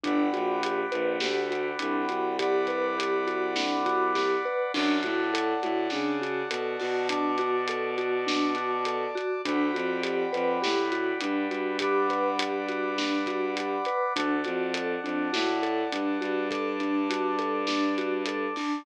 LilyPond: <<
  \new Staff \with { instrumentName = "Vibraphone" } { \time 4/4 \key g \major \tempo 4 = 102 d'8 fis'8 g'8 b'8 g'8 fis'8 d'8 fis'8 | g'8 b'8 g'8 fis'8 d'8 fis'8 g'8 b'8 | d'8 fis'8 a'8 fis'8 d'8 fis'8 a'8 fis'8 | d'8 fis'8 a'8 fis'8 d'8 fis'8 a'8 fis'8 |
d'8 fis'8 g'8 b'8 g'8 fis'8 d'8 fis'8 | g'8 b'8 g'8 fis'8 d'8 fis'8 g'8 b'8 | d'8 fis'8 a'8 d'8 fis'8 a'8 d'8 fis'8 | a'8 d'8 fis'8 a'8 d'8 fis'8 a'8 d'8 | }
  \new Staff \with { instrumentName = "Violin" } { \clef bass \time 4/4 \key g \major g,,8 ais,,4 ais,,8 d,4 c,8 c,8~ | c,1 | fis,8 a,4 a,8 cis4 b,8 b,8~ | b,1 |
d,8 f,4 f,8 a,4 g,8 g,8~ | g,1 | d,8 f,4 f,8 a,4 g,8 g,8~ | g,1 | }
  \new Staff \with { instrumentName = "Brass Section" } { \time 4/4 \key g \major <d'' fis'' g'' b''>1 | <d'' fis'' b'' d'''>1 | <d'' fis'' a''>1 | <d'' a'' d'''>1 |
<d'' fis'' g'' b''>1 | <d'' fis'' b'' d'''>1 | <d'' fis'' a''>1 | <d'' a'' d'''>1 | }
  \new DrumStaff \with { instrumentName = "Drums" } \drummode { \time 4/4 <hh bd>8 hh8 hh8 hh8 sn8 hh8 hh8 hh8 | <hh bd>8 <hh bd>8 hh8 hh8 sn8 <hh bd>8 <bd sn>4 | <cymc bd>8 <hh bd>8 hh8 hh8 sn8 hh8 hh8 hho8 | <hh bd>8 hh8 hh8 hh8 sn8 hh8 hh8 hh8 |
<hh bd>8 hh8 hh8 hh8 sn8 hh8 hh8 hh8 | <hh bd>8 <hh bd>8 hh8 hh8 sn8 <hh bd>8 hh8 hh8 | <hh bd>8 <hh bd>8 hh8 hh8 sn8 hh8 hh8 hh8 | <hh bd>8 hh8 hh8 hh8 sn8 hh8 hh8 hho8 | }
>>